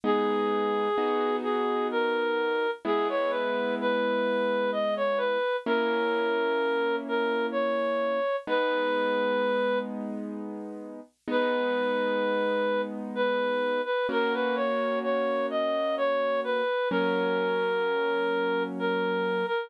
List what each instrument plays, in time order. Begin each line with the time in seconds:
0.04 acoustic grand piano G#3 B3 D#4, clarinet G#4
0.98 acoustic grand piano B3 D#4 F#4
1.43 clarinet G#4
1.91 clarinet A#4
2.85 acoustic grand piano G#3 B3 E4, clarinet G#4
3.09 clarinet C#5
3.30 clarinet B4
3.81 clarinet B4
4.72 clarinet D#5
4.97 clarinet C#5
5.18 clarinet B4
5.66 acoustic grand piano A#3 C#4 E4, clarinet A#4
7.08 clarinet A#4
7.52 clarinet C#5
8.47 acoustic grand piano G#3 B3 D#4, clarinet B4
11.28 acoustic grand piano G#3 B3 D#4, clarinet B4
13.15 clarinet B4
13.85 clarinet B4
14.09 acoustic grand piano A#3 C#4 F#4, clarinet A#4
14.34 clarinet B4
14.56 clarinet C#5
15.03 clarinet C#5
15.50 clarinet D#5
15.97 clarinet C#5
16.44 clarinet B4
16.91 acoustic grand piano F#3 A#3 C#4, clarinet A#4
18.79 clarinet A#4
19.46 clarinet A#4